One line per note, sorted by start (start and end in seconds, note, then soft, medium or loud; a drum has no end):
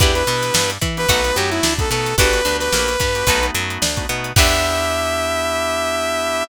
0.00 0.23 E2 loud
0.00 0.12 B3 loud
0.00 0.12 D4 loud
0.00 0.23 D4 loud
0.00 0.12 E4 medium
0.00 0.23 E4 medium
0.00 0.12 G4 medium
0.00 0.14 G4 medium
0.00 0.23 G4 medium
0.00 0.23 B4 medium
0.00 kick loud
0.00 closed hi-hat medium
0.14 0.25 B3 medium
0.14 0.25 D4 medium
0.14 0.25 E4 medium
0.14 0.25 G4 medium
0.14 0.70 B4 medium
0.14 closed hi-hat medium
0.27 0.51 B2 loud
0.27 0.72 B3 medium
0.27 0.52 B3 medium
0.27 0.72 D4 medium
0.27 0.72 E4 medium
0.27 0.72 G4 medium
0.27 closed hi-hat medium
0.42 snare soft
0.42 closed hi-hat medium
0.54 0.78 G2 medium
0.54 0.78 G3 medium
0.54 snare loud
0.70 closed hi-hat medium
0.81 1.06 E3 loud
0.81 1.05 E4 medium
0.81 kick medium
0.81 snare soft
0.81 closed hi-hat medium
0.97 1.07 B3 medium
0.97 1.07 D4 medium
0.97 1.07 E4 medium
0.97 1.07 G4 medium
0.97 1.36 B4 loud
0.97 closed hi-hat medium
1.09 1.33 B1 loud
1.09 1.21 A3 loud
1.09 1.21 B3 loud
1.09 1.21 D#4 medium
1.09 1.31 D#4 medium
1.09 1.21 F#4 loud
1.09 1.31 F#4 medium
1.09 1.31 A4 medium
1.09 1.31 B4 medium
1.09 kick medium
1.09 closed hi-hat loud
1.24 1.67 A3 medium
1.24 1.67 B3 medium
1.24 1.67 D#4 medium
1.24 1.67 F#4 medium
1.24 closed hi-hat medium
1.35 1.60 F#2 medium
1.35 1.61 F#3 medium
1.35 1.50 G4 medium
1.35 closed hi-hat medium
1.50 1.74 E4 loud
1.50 closed hi-hat medium
1.63 1.87 D2 medium
1.63 1.88 D4 medium
1.63 snare loud
1.79 1.89 A3 medium
1.79 1.89 B3 loud
1.79 1.89 D#4 medium
1.79 1.89 F#4 medium
1.79 1.90 A4 medium
1.79 kick medium
1.79 closed hi-hat medium
1.90 2.14 B2 medium
1.90 2.13 A3 medium
1.90 2.13 B3 medium
1.90 2.15 B3 medium
1.90 2.13 D#4 medium
1.90 2.13 F#4 medium
1.90 2.16 A4 medium
1.90 closed hi-hat medium
2.06 snare soft
2.06 closed hi-hat medium
2.18 2.41 G1 loud
2.18 2.30 B3 loud
2.18 2.30 D4 medium
2.18 2.41 D4 medium
2.18 2.30 F#4 loud
2.18 2.41 F#4 medium
2.18 2.30 G4 loud
2.18 2.41 G4 medium
2.18 2.57 B4 loud
2.18 2.41 B4 medium
2.18 kick medium
2.18 closed hi-hat loud
2.33 2.43 B3 medium
2.33 2.43 D4 medium
2.33 2.43 F#4 medium
2.33 2.43 G4 medium
2.33 snare soft
2.33 closed hi-hat medium
2.45 2.69 D2 medium
2.45 2.90 B3 medium
2.45 2.69 D4 medium
2.45 2.90 D4 medium
2.45 2.90 F#4 medium
2.45 2.90 G4 medium
2.45 closed hi-hat medium
2.59 3.46 B4 loud
2.59 snare medium
2.59 closed hi-hat medium
2.73 2.96 A#1 medium
2.73 2.97 A#3 medium
2.73 snare medium
2.88 closed hi-hat medium
3.00 3.23 G2 medium
3.00 3.24 G3 medium
3.00 kick medium
3.00 closed hi-hat medium
3.15 3.25 B3 medium
3.15 3.25 D4 medium
3.15 3.25 F#4 medium
3.15 3.25 G4 medium
3.15 closed hi-hat medium
3.27 3.51 B1 loud
3.27 3.40 A3 medium
3.27 3.40 B3 medium
3.27 3.40 D#4 loud
3.27 3.50 D#4 medium
3.27 3.40 F#4 loud
3.27 3.50 F#4 medium
3.27 3.50 A4 medium
3.27 3.50 B4 medium
3.27 kick medium
3.27 closed hi-hat medium
3.43 3.85 A3 medium
3.43 3.85 B3 medium
3.43 3.85 D#4 medium
3.43 3.85 F#4 medium
3.43 closed hi-hat medium
3.55 3.78 F#2 loud
3.55 3.79 F#3 medium
3.55 snare soft
3.55 closed hi-hat medium
3.70 closed hi-hat medium
3.82 4.05 D2 medium
3.82 4.06 D4 medium
3.82 snare loud
3.97 4.07 A3 medium
3.97 4.07 B3 medium
3.97 4.07 D#4 medium
3.97 4.07 F#4 medium
3.97 kick medium
3.97 closed hi-hat medium
4.09 4.33 B2 medium
4.09 4.32 A3 medium
4.09 4.32 B3 medium
4.09 4.33 B3 medium
4.09 4.32 D#4 medium
4.09 4.32 F#4 medium
4.09 closed hi-hat medium
4.24 closed hi-hat medium
4.36 6.43 E2 loud
4.36 6.43 B3 loud
4.36 6.43 D4 loud
4.36 6.44 D4 loud
4.36 6.43 E4 loud
4.36 6.44 E4 medium
4.36 6.43 G4 loud
4.36 6.44 G4 loud
4.36 6.44 B4 loud
4.36 6.44 E5 loud
4.36 kick loud
4.36 crash loud